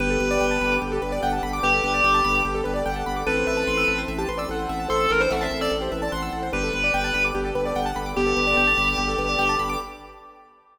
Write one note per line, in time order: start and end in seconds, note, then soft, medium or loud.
0.00 0.17 G1 loud
0.00 3.23 B3 medium
0.00 0.78 B3 medium
0.00 3.23 D4 medium
0.00 3.23 G4 loud
0.00 0.09 G4 loud
0.00 0.78 G4 medium
0.00 3.23 A4 medium
0.00 0.19 B4 loud
0.10 0.19 A4 loud
0.20 0.38 G1 medium
0.20 0.30 B4 loud
0.20 0.71 B4 loud
0.31 0.40 D5 loud
0.41 0.58 G1 medium
0.41 0.50 G5 loud
0.51 0.60 A5 medium
0.61 0.79 G1 medium
0.61 0.70 B5 medium
0.71 0.81 D6 medium
0.82 0.99 G1 medium
0.82 0.91 G4 medium
0.92 1.02 G4 medium
0.92 1.01 A4 loud
1.02 1.19 G1 medium
1.02 1.11 B4 medium
1.02 1.11 B4 loud
1.12 1.21 D5 medium
1.12 1.21 D5 loud
1.22 1.40 G1 medium
1.22 1.60 F#5 medium
1.22 1.32 G5 loud
1.33 1.42 A5 medium
1.43 1.60 G1 medium
1.43 1.52 B5 loud
1.53 1.62 D6 loud
1.63 1.81 G1 medium
1.63 1.72 G4 loud
1.63 1.83 G4 loud
1.63 2.41 B4 medium
1.63 2.41 G5 medium
1.73 1.83 A4 medium
1.84 2.01 G1 medium
1.84 2.35 G4 loud
1.84 1.93 B4 loud
1.94 2.03 D5 loud
2.04 2.21 G1 medium
2.04 2.13 G5 loud
2.14 2.23 A5 medium
2.24 2.42 G1 medium
2.24 2.34 B5 loud
2.35 2.44 D6 medium
2.45 2.62 G1 medium
2.45 2.54 G4 loud
2.54 2.64 G4 medium
2.54 2.64 A4 loud
2.64 2.83 G1 medium
2.64 2.73 B4 medium
2.64 2.75 B4 loud
2.74 2.83 D5 medium
2.74 2.85 D5 medium
2.86 3.03 G1 medium
2.86 3.24 F#5 medium
2.86 2.95 G5 loud
2.96 3.05 A5 medium
3.06 3.24 G1 medium
3.06 3.15 B5 medium
3.16 3.26 D6 medium
3.27 3.44 A1 medium
3.27 6.50 C4 loud
3.27 4.06 C4 medium
3.27 6.50 E4 loud
3.27 3.36 A4 loud
3.27 6.50 A4 medium
3.27 4.06 A4 medium
3.27 3.44 B4 loud
3.37 3.46 C5 medium
3.47 3.64 A1 medium
3.47 3.97 B4 loud
3.47 3.56 E5 medium
3.57 3.66 A5 medium
3.67 3.85 A1 medium
3.67 3.77 C6 medium
3.77 3.87 E6 medium
3.88 4.05 A1 medium
3.88 3.97 A4 medium
3.98 4.07 C5 loud
4.08 4.26 A1 loud
4.08 4.17 E5 medium
4.18 4.27 G4 medium
4.18 4.28 A5 loud
4.29 4.46 A1 medium
4.29 4.38 B4 medium
4.29 4.38 C6 medium
4.38 4.47 D5 medium
4.38 4.48 E6 medium
4.49 4.66 A1 medium
4.49 4.58 A4 medium
4.49 4.88 F#5 medium
4.59 4.68 C5 medium
4.69 4.87 A1 medium
4.69 4.79 E5 loud
4.80 4.89 A5 medium
4.89 5.07 A1 medium
4.89 5.05 E4 medium
4.89 4.99 A4 loud
4.89 5.05 C5 medium
4.89 4.99 C6 loud
5.00 5.10 A4 loud
5.00 5.09 E6 medium
5.10 5.28 A1 medium
5.10 5.19 A4 medium
5.10 5.20 A#4 loud
5.20 5.30 D4 medium
5.20 5.30 B4 medium
5.20 5.30 C5 loud
5.31 5.48 A1 medium
5.31 5.70 C4 medium
5.31 5.70 A4 medium
5.31 5.40 E5 loud
5.31 5.40 F#5 loud
5.41 5.58 E5 loud
5.41 5.50 A5 loud
5.51 5.68 A1 medium
5.51 5.60 C6 medium
5.61 5.71 D5 loud
5.61 5.70 E6 loud
5.71 5.89 A1 medium
5.71 5.81 A4 medium
5.81 5.90 G4 medium
5.81 5.91 C5 medium
5.91 6.09 A1 medium
5.91 6.00 B4 medium
5.91 6.01 E5 medium
6.02 6.12 D5 medium
6.02 6.11 A5 medium
6.12 6.30 A1 medium
6.12 6.49 F#5 medium
6.12 6.21 C6 loud
6.23 6.32 E6 medium
6.33 6.50 A1 medium
6.33 6.42 A4 medium
6.43 6.52 C5 medium
6.52 6.70 G1 loud
6.52 9.77 B3 medium
6.52 7.30 D4 medium
6.52 9.77 D4 medium
6.52 6.62 G4 loud
6.52 9.77 G4 loud
6.52 9.77 A4 medium
6.52 7.30 B4 medium
6.52 6.72 B4 loud
6.63 6.73 A4 medium
6.73 6.91 G1 medium
6.73 7.23 B4 loud
6.73 6.83 B4 medium
6.84 6.93 D5 medium
6.94 7.11 G1 medium
6.94 7.03 G5 loud
7.04 7.13 A5 loud
7.14 7.32 G1 medium
7.14 7.23 B5 medium
7.24 7.34 D6 medium
7.35 7.52 G1 medium
7.35 7.44 G4 loud
7.45 7.55 G4 medium
7.45 7.54 A4 medium
7.55 7.73 G1 medium
7.55 7.64 B4 medium
7.55 7.65 B4 medium
7.65 7.74 D5 medium
7.65 7.76 D5 medium
7.75 7.93 G1 medium
7.75 8.13 F#5 medium
7.75 7.85 G5 loud
7.86 7.95 A5 medium
7.96 8.13 G1 medium
7.96 8.05 B5 medium
8.06 8.15 D6 medium
8.16 8.34 G1 medium
8.16 8.71 B3 medium
8.16 8.26 G4 loud
8.16 9.54 G4 loud
8.16 8.71 G4 medium
8.27 8.36 A4 medium
8.37 8.54 G1 medium
8.37 8.46 B4 medium
8.47 8.56 D5 loud
8.57 8.74 G1 medium
8.57 8.66 G5 loud
8.67 8.77 A5 medium
8.78 8.95 G1 medium
8.78 8.87 B5 medium
8.88 8.97 D6 medium
8.98 9.15 G1 medium
8.98 9.07 G4 loud
9.08 9.17 A4 medium
9.18 9.36 G1 medium
9.18 9.28 B4 medium
9.29 9.38 D5 medium
9.39 9.56 G1 medium
9.39 9.48 G5 loud
9.49 9.58 A5 medium
9.59 9.77 G1 medium
9.59 9.68 B5 loud
9.69 9.79 D6 loud